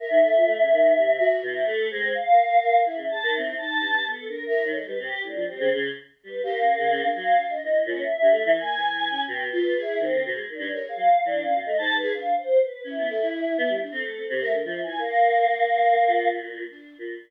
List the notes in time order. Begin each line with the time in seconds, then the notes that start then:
0.00 A#4 E5
0.10 D#3
0.23 A4
0.37 F4
0.46 A3
0.60 C#3
0.72 D#3
0.97 C3
1.19 F#4
1.42 B2 E4
1.66 A3 A4
1.90 G#3 C4
2.15 F5
2.32 A#4
2.86 E4 E5
2.96 C#3
3.09 G#4 A5
3.23 D#3
3.33 E4
3.37 C4
3.57 D#4 A5
3.80 G2
4.05 B3
4.10 A4
4.28 D4 A#4
4.46 E4 A#4
4.64 D#3 C#5
4.74 G#3 A4
4.87 G3 B4
4.99 C3 G4
5.13 G4
5.23 A2 D4
5.35 F3
5.47 G3 C4
5.59 C#3
5.73 C#3
6.23 G3 B4
6.43 A#3 G4
6.60 C#4
6.78 C#3
6.90 C#3
7.03 D4
7.14 F#3 F5
7.38 D4
7.50 D#5
7.63 E3
7.86 A#2 C#4
8.03 E5
8.21 G2
8.31 A3
8.45 E3
8.57 A#3 G#5
8.76 E3
9.10 C#4
9.27 B2 G5
9.46 B4
9.52 F4
9.76 G#4
9.82 E4
10.00 D#3 C4
10.12 D3
10.26 B2
10.35 G#3
10.49 D#3
10.54 D4
10.59 G2
10.71 A#4 C#5
10.84 G#4
10.89 F5
10.96 F#3
11.25 E3 D4
11.42 C#4 F5
11.55 B2
11.61 D#5
11.66 A3
11.78 G#2 A5
11.92 G#2
11.96 B4
12.02 G#4
12.14 D4 F5
12.38 C5
12.62 B4
12.84 C#4 E4
12.98 B3
13.09 A4
13.21 E4
13.58 B3
13.69 G3
13.83 D4
13.92 C4 A4
14.04 A3
14.17 C4
14.28 C3 C5
14.41 A3 A#4
14.53 D3 A#4
14.64 F3 E5
14.83 E3 G#5
14.98 A#3 A#4
16.07 A#2
16.70 D4
16.98 A#2